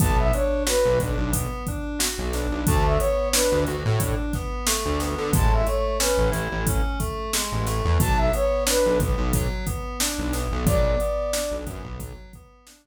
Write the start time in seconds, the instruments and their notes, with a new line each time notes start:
0.00 synth bass 1 B1, electric piano 2 B3, flute A5, kick, closed hi-hat
0.19 flute E5
0.33 electric piano 2 D4, flute C#5, closed hi-hat
0.67 electric piano 2 F#4, flute B4, snare
0.85 synth bass 1 B1
1.00 synth bass 1 B1, electric piano 2 D4, kick, closed hi-hat
1.18 synth bass 1 B1
1.33 electric piano 2 B3, kick, closed hi-hat
1.67 electric piano 2 D4, kick, closed hi-hat
1.99 electric piano 2 F#4, snare
2.18 synth bass 1 B1
2.33 electric piano 2 D4, snare, closed hi-hat
2.51 synth bass 1 B1
2.66 synth bass 1 D2, electric piano 2 A3, flute A5, kick, closed hi-hat
2.84 flute E5
2.99 electric piano 2 B3, flute C#5, closed hi-hat
3.33 electric piano 2 D4, flute B4, snare
3.52 synth bass 1 D2
3.67 synth bass 1 D2, electric piano 2 F#4, closed hi-hat
3.85 synth bass 1 A2
4.00 electric piano 2 D4, kick, closed hi-hat
4.33 electric piano 2 B3, kick, snare, closed hi-hat
4.67 electric piano 2 A3, snare
4.85 synth bass 1 D2
5.00 electric piano 2 B3, snare, closed hi-hat
5.18 synth bass 1 D3
5.33 synth bass 1 A1, electric piano 2 G#3, flute A5, kick, closed hi-hat
5.53 flute E5
5.67 electric piano 2 A3, flute C#5, closed hi-hat
6.00 electric piano 2 C#4, flute B4, snare
6.18 synth bass 1 A1
6.32 synth bass 1 A1, electric piano 2 E4, closed hi-hat
6.52 synth bass 1 A1
6.67 electric piano 2 C#4, kick, closed hi-hat
7.00 electric piano 2 A3, kick, closed hi-hat
7.33 electric piano 2 G#3, snare
7.52 synth bass 1 A1
7.67 electric piano 2 A3, snare, closed hi-hat
7.85 synth bass 1 E2
8.00 synth bass 1 B1, electric piano 2 F#3, flute A5, kick, closed hi-hat
8.18 flute E5
8.33 electric piano 2 B3, flute C#5, closed hi-hat
8.67 electric piano 2 D4, flute B4, snare
8.86 synth bass 1 B1
8.99 synth bass 1 B1, electric piano 2 B3, kick, closed hi-hat
9.18 synth bass 1 B1
9.33 electric piano 2 F#3, kick, closed hi-hat
9.67 electric piano 2 B3, kick, closed hi-hat
10.00 electric piano 2 D4, snare
10.18 synth bass 1 B1
10.33 electric piano 2 B3, snare, closed hi-hat
10.52 synth bass 1 B1
10.66 synth bass 1 B1, electric piano 2 F#3, flute D5, kick, closed hi-hat
11.00 electric piano 2 B3, closed hi-hat
11.33 electric piano 2 D4, snare
11.51 synth bass 1 B1
11.66 synth bass 1 F#2, electric piano 2 B3, kick, closed hi-hat
11.84 synth bass 1 B1
12.00 electric piano 2 F#3, kick, closed hi-hat
12.33 electric piano 2 B3, kick, closed hi-hat
12.67 electric piano 2 D4, snare
12.85 synth bass 1 B1